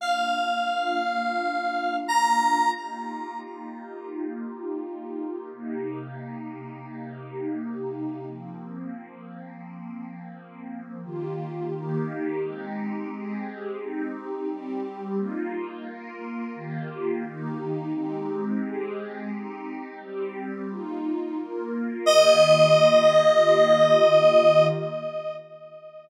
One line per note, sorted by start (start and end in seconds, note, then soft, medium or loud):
0.00 2.73 A#3 medium
0.00 2.73 D4 medium
0.00 2.73 F4 medium
0.00 1.97 F5 medium
2.08 2.70 A#5 medium
2.76 5.49 A#3 medium
2.76 5.49 D#4 medium
2.76 5.49 F4 medium
2.76 5.49 G4 medium
5.52 8.25 C3 medium
5.52 8.25 A#3 medium
5.52 8.25 D#4 medium
5.52 8.25 G4 medium
8.28 11.01 F3 medium
8.28 11.01 A#3 medium
8.28 11.01 C4 medium
11.04 11.72 D#3 medium
11.04 11.72 A#3 medium
11.04 11.72 F4 medium
11.04 11.72 G4 medium
11.72 12.41 D#3 loud
11.72 12.41 A#3 medium
11.72 12.41 D#4 medium
11.72 12.41 G4 loud
12.42 13.10 G#3 medium
12.42 13.10 C4 medium
12.42 13.10 D#4 medium
12.42 13.10 G4 loud
13.10 13.79 G#3 medium
13.10 13.79 C4 medium
13.10 13.79 G4 medium
13.10 13.79 G#4 medium
13.79 14.48 C4 loud
13.79 14.48 D#4 medium
13.79 14.48 G4 medium
14.48 15.17 G3 loud
14.48 15.17 C4 loud
14.48 15.17 G4 loud
15.17 15.85 A#3 loud
15.17 15.85 D#4 medium
15.17 15.85 F4 loud
15.86 16.54 A#3 medium
15.86 16.54 F4 medium
15.86 16.54 A#4 loud
16.55 17.23 D#3 medium
16.55 17.23 A#3 loud
16.55 17.23 F4 medium
16.55 17.23 G4 medium
17.24 17.92 D#3 medium
17.24 17.92 A#3 medium
17.24 17.92 D#4 loud
17.24 17.92 G4 medium
17.93 18.61 G#3 medium
17.93 18.61 C4 loud
17.93 18.61 D#4 medium
17.93 18.61 G4 loud
18.62 19.30 G#3 loud
18.62 19.30 C4 medium
18.62 19.30 G4 loud
18.62 19.30 G#4 medium
19.31 19.99 C4 medium
19.31 19.99 D#4 medium
19.31 19.99 G4 medium
20.00 20.69 G3 medium
20.00 20.69 C4 medium
20.00 20.69 G4 loud
20.69 21.37 A#3 medium
20.69 21.37 D#4 loud
20.69 21.37 F4 loud
21.38 22.06 A#3 medium
21.38 22.06 F4 medium
21.38 22.07 A#4 medium
22.06 24.68 D#3 loud
22.06 24.68 A#3 loud
22.06 24.68 F4 medium
22.06 24.68 G4 medium
22.06 24.67 D#5 loud